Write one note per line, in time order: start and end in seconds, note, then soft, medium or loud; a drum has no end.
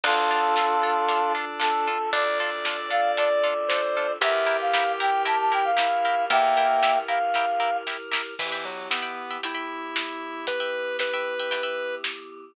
0.03 1.96 D2 loud
0.03 4.17 D4 medium
0.03 1.88 D4 medium
0.03 0.15 D4 loud
0.03 4.17 F4 medium
0.03 0.15 F4 loud
0.03 1.32 F4 medium
0.03 4.17 A4 medium
0.03 0.15 A4 loud
0.03 1.32 A4 medium
0.03 kick loud
0.03 crash loud
0.31 0.41 D4 medium
0.31 0.41 F4 medium
0.31 0.41 A4 medium
0.56 0.66 D4 medium
0.56 0.66 F4 medium
0.56 0.66 A4 medium
0.56 snare medium
0.83 0.94 D4 loud
0.83 0.94 F4 medium
0.83 0.94 A4 medium
1.09 1.19 D4 medium
1.09 1.19 F4 medium
1.09 1.19 A4 medium
1.09 closed hi-hat medium
1.35 1.45 D4 medium
1.35 1.45 F4 medium
1.35 1.45 A4 medium
1.60 1.70 D4 medium
1.60 1.70 F4 medium
1.60 1.70 A4 medium
1.60 2.10 A4 medium
1.60 snare loud
1.87 1.98 D4 medium
1.87 1.98 F4 medium
1.87 1.98 A4 medium
2.13 4.05 D2 medium
2.13 2.24 D4 medium
2.13 2.24 F4 medium
2.13 2.24 A4 medium
2.13 3.47 D5 medium
2.13 2.38 D5 medium
2.13 kick loud
2.13 closed hi-hat medium
2.39 2.50 D4 loud
2.39 2.50 F4 medium
2.39 2.50 A4 medium
2.39 2.89 D5 medium
2.65 2.77 D4 medium
2.65 2.77 F4 medium
2.65 2.77 A4 medium
2.65 snare loud
2.90 3.01 D4 medium
2.90 3.01 F4 medium
2.90 3.01 A4 medium
2.90 3.11 F5 medium
3.17 3.29 D4 medium
3.17 3.29 F4 medium
3.17 3.29 A4 medium
3.17 4.12 D5 medium
3.17 closed hi-hat loud
3.43 3.54 D4 medium
3.43 3.54 F4 medium
3.43 3.54 A4 medium
3.69 3.82 D4 medium
3.69 3.82 F4 medium
3.69 3.82 A4 medium
3.69 4.11 C5 medium
3.69 snare loud
3.97 4.07 D4 medium
3.97 4.07 F4 medium
3.97 4.07 A4 medium
4.21 6.14 E2 loud
4.21 8.34 E4 medium
4.21 4.32 E4 loud
4.21 5.71 G4 medium
4.21 8.34 G4 medium
4.21 4.32 G4 loud
4.21 8.34 A#4 medium
4.21 4.32 A#4 loud
4.21 4.57 E5 medium
4.21 kick medium
4.21 closed hi-hat medium
4.46 4.57 E4 medium
4.46 4.57 G4 medium
4.46 4.57 A#4 medium
4.61 4.92 F5 medium
4.73 4.84 E4 medium
4.73 4.84 G4 medium
4.73 4.84 A#4 medium
4.73 snare loud
5.00 5.11 E4 medium
5.00 5.11 G4 medium
5.00 5.11 A#4 medium
5.00 5.22 G5 medium
5.25 5.36 E4 medium
5.25 5.36 G4 medium
5.25 5.36 A#4 medium
5.25 5.38 A5 medium
5.25 closed hi-hat medium
5.40 5.52 A5 medium
5.52 5.62 E4 medium
5.52 5.62 G4 medium
5.52 5.62 A#4 medium
5.52 5.65 G5 medium
5.64 6.24 F5 medium
5.77 5.87 E4 medium
5.77 6.25 E4 medium
5.77 5.87 G4 medium
5.77 5.87 A#4 medium
5.77 snare loud
6.05 6.15 E4 medium
6.05 6.15 G4 medium
6.05 6.15 A#4 medium
6.30 8.22 E2 loud
6.30 6.97 A#3 loud
6.30 6.41 E4 medium
6.30 6.41 G4 medium
6.30 6.41 A#4 medium
6.30 6.98 E5 medium
6.30 6.98 G5 medium
6.30 kick loud
6.30 closed hi-hat medium
6.57 6.67 E4 medium
6.57 6.67 G4 medium
6.57 6.67 A#4 medium
6.83 6.93 E4 medium
6.83 6.93 G4 medium
6.83 6.93 A#4 medium
6.83 snare loud
7.08 7.19 E4 medium
7.08 7.19 G4 loud
7.08 7.19 A#4 medium
7.08 7.77 F5 medium
7.34 7.46 E4 medium
7.34 7.46 G4 medium
7.34 7.46 A#4 medium
7.34 kick medium
7.34 snare medium
7.60 7.70 E4 medium
7.60 7.70 G4 medium
7.60 7.70 A#4 medium
7.87 7.97 E4 medium
7.87 7.97 G4 medium
7.87 7.97 A#4 medium
7.87 snare medium
8.12 8.22 E4 medium
8.12 8.22 G4 medium
8.12 8.22 A#4 medium
8.12 snare loud
8.39 8.64 E3 medium
8.39 12.52 E3 medium
8.39 12.52 B3 medium
8.39 12.52 G4 medium
8.39 8.50 E5 loud
8.39 8.50 G5 medium
8.39 8.50 B5 medium
8.39 kick loud
8.39 crash loud
8.52 8.83 E5 medium
8.52 8.83 G5 medium
8.52 8.83 B5 medium
8.65 8.88 F#3 medium
8.90 9.37 B3 medium
8.90 9.01 E5 medium
8.90 9.01 G5 medium
8.90 9.01 B5 medium
8.90 snare loud
9.02 9.23 E5 medium
9.02 9.23 G5 medium
9.02 9.23 B5 medium
9.31 9.41 E5 medium
9.31 9.41 G5 medium
9.31 9.41 B5 medium
9.43 10.46 E4 medium
9.43 9.54 E5 medium
9.43 9.54 G5 medium
9.43 9.54 B5 medium
9.43 closed hi-hat medium
9.55 9.96 E5 medium
9.55 9.96 G5 medium
9.55 9.96 B5 medium
9.96 snare loud
10.47 10.97 B4 loud
10.47 kick loud
10.47 closed hi-hat medium
10.60 10.91 E5 medium
10.60 10.91 G5 medium
10.60 10.91 B5 medium
10.99 11.95 B4 medium
10.99 11.09 E5 medium
10.99 11.09 G5 medium
10.99 11.09 B5 medium
10.99 snare medium
11.13 11.34 E5 medium
11.13 11.34 G5 medium
11.13 11.34 B5 medium
11.39 11.50 E5 medium
11.39 11.50 G5 medium
11.39 11.50 B5 medium
11.51 11.62 E5 medium
11.51 11.62 G5 medium
11.51 11.62 B5 medium
11.51 closed hi-hat medium
11.63 12.05 E5 medium
11.63 12.05 G5 medium
11.63 12.05 B5 medium
12.04 snare loud